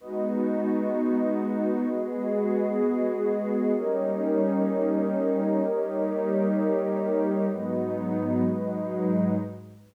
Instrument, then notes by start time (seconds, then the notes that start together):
pad 2 (warm)
0.00 G#3 B3 D#4 F#4 B4 D#5
1.87 G#3 B3 F#4 G#4
3.74 G3 A#3 C#4 D#4 G4 A#4 C#5 D#5
5.62 G3 A#3 D#4 G4
7.50 G#2 F#3 G#3 B3 D#4 F#4 B4 D#5
8.44 G#2 F#3 G#3 D#4